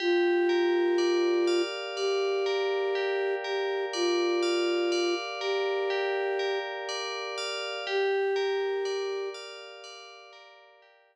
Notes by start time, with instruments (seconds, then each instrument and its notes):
0.00 flute F4, tubular bells G4
0.49 tubular bells A#4
0.98 tubular bells D5
1.47 tubular bells F5
1.96 flute G4, tubular bells D5
2.46 tubular bells A#4
2.95 tubular bells G4
3.44 flute G4, tubular bells A#4
3.93 flute F4, tubular bells D5
4.43 tubular bells F5
4.92 tubular bells D5
5.40 flute G4, tubular bells A#4
5.90 tubular bells G4
6.39 tubular bells A#4
6.89 tubular bells D5
7.38 tubular bells F5
7.87 tubular bells G4, flute G4
8.36 tubular bells A#4
8.85 tubular bells D5
9.34 tubular bells F5
9.84 tubular bells D5
10.33 tubular bells A#4
10.82 tubular bells G4